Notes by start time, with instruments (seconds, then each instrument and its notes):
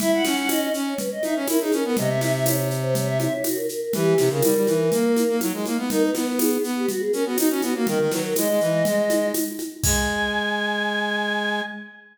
0.00 brass section E4, choir aahs E5, low conga, shaker
0.14 choir aahs F#5
0.24 brass section C#4, choir aahs F#5, snare, high conga, shaker
0.37 choir aahs F#5
0.49 choir aahs D#5, tambourine, high conga, shaker
0.61 choir aahs D#5
0.74 brass section C#4, shaker
0.87 choir aahs C#5
0.98 choir aahs B4, low conga, shaker
1.12 choir aahs D#5
1.23 brass section D#4, choir aahs E5, high conga, shaker
1.35 brass section C#4, choir aahs C#5
1.48 brass section E4, choir aahs A#4, tambourine, high conga, shaker
1.60 brass section D#4, choir aahs G#4
1.72 brass section C#4, choir aahs A#4, high conga, shaker
1.84 brass section B3, choir aahs A#4
1.97 brass section C3, choir aahs D#5, low conga, shaker
2.09 choir aahs E5
2.21 choir aahs E5, snare, high conga, shaker
2.33 choir aahs E5
2.45 choir aahs C#5, tambourine, high conga, shaker
2.57 choir aahs C#5
2.71 shaker
2.82 choir aahs C5
2.95 choir aahs C#5, low conga, shaker
3.06 choir aahs E5
3.20 choir aahs E5, high conga, shaker
3.32 choir aahs C#5
3.44 choir aahs F#4, tambourine, high conga, shaker
3.55 choir aahs A#4
3.69 choir aahs A#4, shaker
3.81 choir aahs A#4
3.93 brass section E3, choir aahs G4, low conga, shaker
4.18 brass section C3, snare, high conga, shaker
4.30 brass section C#3, choir aahs A#4
4.43 brass section G3, tambourine, high conga, shaker
4.55 brass section G3
4.67 brass section E3, high conga, shaker
4.92 brass section A#3, low conga, shaker
5.16 high conga, shaker
5.28 brass section A#3
5.41 brass section F#3, tambourine, high conga, shaker
5.53 brass section G#3
5.65 brass section A#3, high conga, shaker
5.78 brass section B3
5.90 brass section D#4, choir aahs A#4, low conga, shaker
6.03 choir aahs B4
6.15 brass section B3, choir aahs B4, snare, high conga, shaker
6.27 choir aahs B4
6.39 choir aahs G#4, tambourine, high conga, shaker
6.51 choir aahs G#4
6.64 brass section B3, shaker
6.77 choir aahs G4
6.89 choir aahs F#4, low conga, shaker
7.00 choir aahs G#4
7.12 brass section C#4, choir aahs A#4, shaker
7.25 brass section B3, choir aahs F#4
7.37 brass section D#4, choir aahs F#4, tambourine, high conga, shaker
7.49 brass section C#4, choir aahs F#4
7.62 brass section B3, choir aahs F#4, high conga, shaker
7.75 brass section A#3, choir aahs F#4
7.87 brass section D#3, choir aahs A#4, low conga, shaker
7.99 brass section D#3
8.10 brass section F#3, choir aahs B4, snare, high conga, shaker
8.24 choir aahs A#4
8.36 brass section G#3, choir aahs D#5, tambourine, high conga, shaker
8.48 brass section G#3
8.61 brass section E3, shaker
8.85 brass section G#3, low conga, shaker
9.10 high conga, shaker
9.34 tambourine, high conga, shaker
9.59 high conga, shaker
9.83 brass section G#3, choir aahs G#5, kick, crash